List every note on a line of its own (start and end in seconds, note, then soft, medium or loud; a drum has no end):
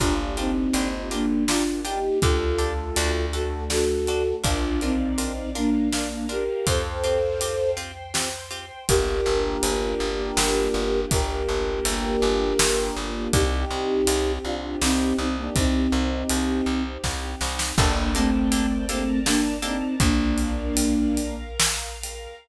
0.00 0.69 G1 medium
0.00 2.20 A#3 medium
0.00 0.15 D4 medium
0.00 0.33 D4 medium
0.00 2.20 D4 medium
0.00 0.15 F4 medium
0.00 0.33 F4 medium
0.00 2.20 F4 medium
0.00 0.15 G4 medium
0.00 2.20 G4 medium
0.00 0.15 A#4 medium
0.00 kick medium
0.00 ride medium
0.37 1.09 C4 medium
0.37 0.52 D4 medium
0.37 1.09 D#4 medium
0.37 0.52 F4 medium
0.37 0.52 G4 medium
0.37 0.52 A#4 medium
0.37 ride medium
0.73 2.10 G1 medium
0.73 0.88 D4 medium
0.73 0.88 F4 medium
0.73 0.88 G4 medium
0.73 0.88 A#4 medium
0.73 ride medium
1.11 1.44 A#3 medium
1.11 1.26 D4 medium
1.11 1.44 D4 medium
1.11 1.26 F4 medium
1.11 1.26 G4 medium
1.11 1.26 A#4 medium
1.11 ride medium
1.48 1.63 D4 medium
1.48 1.81 D4 medium
1.48 1.63 F4 medium
1.48 1.81 F4 medium
1.48 1.63 G4 medium
1.48 1.63 A#4 medium
1.48 snare loud
1.85 1.99 D4 medium
1.85 2.19 D#4 medium
1.85 1.99 F4 medium
1.85 1.99 G4 medium
1.85 2.19 G4 medium
1.85 1.99 A#4 medium
1.85 ride medium
2.21 2.91 D2 medium
2.21 2.95 A3 medium
2.21 2.95 D4 medium
2.21 2.38 D4 medium
2.21 3.25 F4 medium
2.21 2.95 G4 medium
2.21 2.38 G4 medium
2.21 3.25 A4 loud
2.21 2.38 A4 medium
2.21 kick loud
2.21 ride medium
2.58 2.73 D4 medium
2.58 2.73 G4 medium
2.58 2.73 A4 medium
2.58 ride medium
2.96 4.33 D2 medium
2.96 4.43 A3 medium
2.96 4.43 D4 medium
2.96 3.11 D4 medium
2.96 4.43 F#4 medium
2.96 3.11 F#4 medium
2.96 3.11 A4 medium
2.96 ride loud
3.33 3.48 D4 medium
3.33 3.48 F#4 medium
3.33 3.64 F#4 medium
3.33 3.48 A4 medium
3.33 3.64 A4 medium
3.33 ride medium
3.70 3.85 D4 medium
3.70 3.85 F#4 medium
3.70 4.36 F#4 medium
3.70 3.85 A4 medium
3.70 4.36 A4 medium
3.70 snare medium
4.07 4.23 D4 medium
4.07 4.23 F#4 medium
4.07 4.23 A4 medium
4.07 ride medium
4.44 6.49 A#1 medium
4.44 4.58 D4 medium
4.44 4.80 D4 medium
4.44 4.58 F4 medium
4.44 4.80 F4 loud
4.44 4.58 A#4 medium
4.44 5.54 A#4 medium
4.44 5.54 D5 medium
4.44 5.54 F5 medium
4.44 kick loud
4.44 ride loud
4.81 5.50 C4 medium
4.81 4.97 D4 medium
4.81 5.50 D#4 medium
4.81 4.97 F4 medium
4.81 4.97 A#4 medium
4.81 ride medium
5.18 5.33 D4 medium
5.18 5.33 F4 medium
5.18 5.33 A#4 medium
5.18 ride medium
5.55 5.89 A#3 medium
5.55 5.70 D4 medium
5.55 5.89 D4 medium
5.55 5.70 F4 medium
5.55 5.70 A#4 medium
5.55 6.67 A#4 medium
5.55 6.66 F5 medium
5.55 6.67 A#5 soft
5.55 ride medium
5.92 6.26 A#3 medium
5.92 6.26 D4 medium
5.92 6.08 D4 medium
5.92 6.08 F4 medium
5.92 6.08 A#4 medium
5.92 snare medium
6.29 6.44 D4 medium
6.29 6.44 F4 medium
6.29 6.66 G4 medium
6.29 6.44 A#4 medium
6.29 6.66 A#4 medium
6.29 ride medium
6.66 8.71 F2 medium
6.66 6.82 C4 medium
6.66 6.82 F4 medium
6.66 6.82 G4 medium
6.66 7.71 A4 medium
6.66 7.76 C5 medium
6.66 7.71 C5 medium
6.66 7.76 F5 medium
6.66 7.76 G5 medium
6.66 kick loud
6.66 ride loud
7.04 7.19 C4 medium
7.04 7.19 F4 medium
7.04 7.19 G4 medium
7.04 ride medium
7.41 7.56 C4 medium
7.41 7.56 F4 medium
7.41 7.56 G4 medium
7.41 ride loud
7.77 7.92 C4 medium
7.77 7.92 F4 medium
7.77 7.92 G4 medium
7.77 8.88 C5 medium
7.77 8.88 G5 medium
7.77 8.88 C6 medium
7.77 ride medium
8.14 8.29 C4 medium
8.14 8.29 F4 medium
8.14 8.29 G4 medium
8.14 snare loud
8.51 8.65 C4 medium
8.51 8.65 F4 medium
8.51 8.65 G4 medium
8.51 ride medium
8.89 9.21 G1 medium
8.89 13.29 A#3 loud
8.89 13.29 D4 loud
8.89 13.29 F4 medium
8.89 11.00 G4 medium
8.89 13.29 G4 medium
8.89 11.00 A#4 loud
8.89 kick loud
8.89 ride loud
9.26 9.57 G1 medium
9.63 9.94 G1 medium
9.63 ride loud
10.00 10.32 G1 medium
10.37 10.69 G1 medium
10.37 snare loud
10.74 11.06 G1 medium
11.11 11.43 G1 medium
11.11 12.98 G4 medium
11.11 12.98 A#4 loud
11.11 kick loud
11.11 ride loud
11.49 11.80 G1 medium
11.85 12.17 G1 medium
11.85 ride loud
12.22 12.54 G1 medium
12.59 12.91 G1 medium
12.59 snare loud
12.96 13.28 G1 medium
13.33 13.65 C2 medium
13.33 17.73 C4 medium
13.33 17.73 D#4 medium
13.33 14.32 D#4 medium
13.33 17.73 G4 medium
13.33 14.32 G4 loud
13.33 kick loud
13.33 ride loud
13.71 14.02 C2 medium
14.07 14.39 C2 medium
14.07 ride loud
14.45 14.76 C2 medium
14.45 14.77 D4 medium
14.45 14.77 F4 medium
14.81 15.13 C2 medium
14.81 15.16 C4 medium
14.81 15.16 D#4 medium
14.81 snare loud
15.18 15.50 C2 medium
15.18 15.36 C4 medium
15.18 15.36 D#4 medium
15.38 15.55 A#3 medium
15.38 15.55 D4 medium
15.55 15.88 C2 medium
15.55 16.83 C4 medium
15.55 16.83 D#4 loud
15.55 kick loud
15.55 ride loud
15.92 16.24 C2 medium
16.29 16.61 C2 medium
16.29 ride loud
16.66 16.98 C2 medium
17.04 17.35 C2 medium
17.04 kick medium
17.04 snare medium
17.41 17.73 C2 medium
17.41 snare medium
17.59 snare medium
17.78 19.82 G1 loud
17.78 18.11 A#3 loud
17.78 17.93 A#3 medium
17.78 18.11 D4 loud
17.78 17.93 D4 loud
17.78 17.93 G4 loud
17.78 17.93 A4 loud
17.78 18.88 A#4 medium
17.78 18.88 D5 medium
17.78 18.88 G5 medium
17.78 18.88 A5 medium
17.78 kick loud
17.78 crash loud
18.15 18.86 A3 medium
18.15 18.30 A#3 medium
18.15 18.86 C4 medium
18.15 18.30 D4 medium
18.15 18.30 G4 medium
18.15 18.30 A4 medium
18.15 ride medium
18.52 18.67 A#3 medium
18.52 18.67 D4 medium
18.52 18.67 G4 medium
18.52 18.67 A4 medium
18.52 ride loud
18.88 19.19 A3 medium
18.88 19.04 A#3 medium
18.88 19.19 C4 medium
18.88 19.04 D4 medium
18.88 19.04 G4 medium
18.88 19.04 A4 medium
18.88 20.00 A#4 medium
18.88 20.00 D5 medium
18.88 20.00 A5 medium
18.88 20.00 A#5 medium
18.88 ride medium
19.26 19.57 A#3 medium
19.26 19.41 A#3 medium
19.26 19.57 D4 loud
19.26 19.41 D4 medium
19.26 19.41 G4 medium
19.26 19.41 A4 medium
19.26 snare loud
19.62 19.77 A#3 medium
19.62 19.95 C4 medium
19.62 19.77 D4 medium
19.62 19.95 D#4 medium
19.62 19.77 G4 medium
19.62 19.77 A4 medium
19.62 ride medium
20.00 22.27 A#1 medium
20.00 21.35 A#3 medium
20.00 21.35 D4 loud
20.00 21.16 A#4 medium
20.00 21.16 D5 medium
20.00 21.16 F5 medium
20.00 kick loud
20.00 ride loud
20.38 ride medium
20.77 ride loud
21.17 22.47 A#4 medium
21.17 22.47 F5 medium
21.17 22.47 A#5 medium
21.17 ride medium
21.60 snare loud
22.03 ride medium